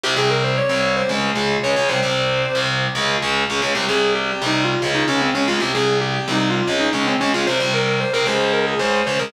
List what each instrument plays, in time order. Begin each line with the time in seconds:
0.03 overdriven guitar C2 C3 G3, distortion guitar G4
0.16 overdriven guitar C2 C3 G3, distortion guitar G#4
0.30 distortion guitar A#4
0.43 distortion guitar C5
0.57 distortion guitar C#5
0.69 overdriven guitar C2 C3 G3, distortion guitar C#5
0.96 distortion guitar C5
1.09 overdriven guitar C#2 C#3 G#3
1.35 overdriven guitar C#2 C#3 G#3
1.63 overdriven guitar C#2 C#3 G#3, distortion guitar C#5
1.76 overdriven guitar C#2 C#3 G#3
1.89 overdriven guitar C2 C3 G3, distortion guitar C5
2.03 overdriven guitar C2 C3 G3
2.55 overdriven guitar C2 C3 G3
2.95 overdriven guitar C#2 C#3 G#3
3.22 overdriven guitar C#2 C#3 G#3
3.50 overdriven guitar C#2 C#3 G#3
3.62 overdriven guitar C#2 C#3 G#3
3.75 overdriven guitar C2 C3 G3, distortion guitar G4
3.89 overdriven guitar C2 C3 G3, distortion guitar G#4
4.15 distortion guitar G4
4.29 distortion guitar G4
4.42 overdriven guitar C2 C3 G3
4.46 distortion guitar D#4
4.64 distortion guitar F4
4.82 overdriven guitar C#2 C#3 G#3
4.95 distortion guitar D#4
5.08 overdriven guitar C#2 C#3 G#3, distortion guitar C#4
5.21 distortion guitar C4
5.34 overdriven guitar C#2 C#3 G#3, distortion guitar C#4
5.48 overdriven guitar C#2 C#3 G#3, distortion guitar F4
5.60 overdriven guitar C2 C3 G3, distortion guitar G4
5.74 overdriven guitar C2 C3 G3, distortion guitar G#4
6.01 distortion guitar G4
6.14 distortion guitar G4
6.28 overdriven guitar C2 C3 G3
6.32 distortion guitar D#4
6.50 distortion guitar F4
6.67 overdriven guitar C#2 C#3 G#3
6.80 distortion guitar D#4
6.93 overdriven guitar C#2 C#3 G#3, distortion guitar C#4
7.07 distortion guitar C4
7.20 overdriven guitar C#2 C#3 G#3, distortion guitar C#4
7.34 overdriven guitar C#2 C#3 G#3, distortion guitar F4
7.47 overdriven guitar C2 C3 G3, distortion guitar C5
7.60 overdriven guitar C2 C3 G3
7.73 distortion guitar A#4
7.87 distortion guitar A#4
8.00 distortion guitar C5
8.13 overdriven guitar C2 C3 G3, distortion guitar A#4
8.26 overdriven guitar C#2 C#3 G#3, distortion guitar C5
8.53 distortion guitar A#4
8.67 distortion guitar G#4
8.79 overdriven guitar C#2 C#3 G#3, distortion guitar C5
8.93 distortion guitar C5
9.06 overdriven guitar C#2 C#3 G#3, distortion guitar C5
9.19 overdriven guitar C#2 C#3 G#3, distortion guitar A#4